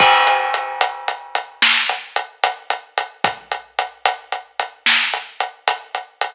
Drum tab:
CC |x-----------|------------|
HH |-xxxxx-xxxxx|xxxxxx-xxxxx|
SD |------o-----|------o-----|
BD |o-----------|o-----------|